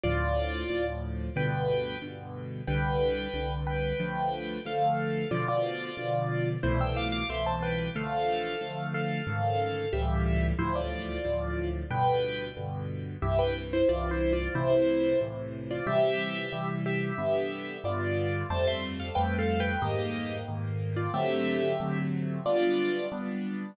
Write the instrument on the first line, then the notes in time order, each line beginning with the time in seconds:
acoustic grand piano
0.03 D2 A2 F3 F4 D5
0.70 D2 A2 F3
1.36 G2 B2 D3 B4 G5
2.02 G2 B2 D3
2.67 C2 D3 G3 B4 G5
3.34 C2 D3 G3
3.67 B4 G5
4.00 D3 F3 A3
4.65 D3 F3 A3 A4 F5
5.31 B2 D3 F3 F4 D5
5.48 F4 D5
5.97 B2 D3 F3
6.63 C2 B2 E3 A3 E4 C5
6.81 G5 E6
6.96 F5 D6
7.12 F5 D6
7.29 C2 B2 E3 A3 E5 C6
7.46 C5 A5
7.63 B4 G5
7.95 D3 F3 A3 A4 F5
8.61 D3 F3 A3
8.94 A4 F5
9.27 G#2 C#3 D#3
9.93 C#2 A2 E3 G3 G4 E5
10.59 D2 A2 F3 E4 C5
10.75 F4 D5
11.25 D2 A2 F3
11.90 G2 B2 D3 B4 G5
12.57 G2 B2 D3
13.22 C2 G2 E3 G4 E5
13.39 B4 G5
13.73 E4 C5
13.89 C2 G2 E3 F4 D5
14.11 E4 C5
14.33 F4 D5
14.55 A2 C3 E3 E4 C5
15.21 A2 C3 E3
15.70 F4 D5
15.87 C3 E3 G3 G4 E5
16.52 C3 E3 G3
16.86 G4 E5
17.18 G2 D3 B3
17.84 G2 D3 B3 F4 D5
18.50 F2 G3 A3 C4 C5 A5
18.67 E5 C6
19.00 A4 F5
19.15 F2 G3 A3 C4 B4 G5
19.38 A4 F5
19.60 B4 G5
19.82 G#2 D#3 A#3 G4 D#5
20.48 G#2 D#3 A#3
20.96 F4 D5
21.13 D3 F#3 A3 C4 G4 E5
21.80 D3 F#3 A3 C4
22.46 G3 B3 D4 F4 D5
23.12 G3 B3 D4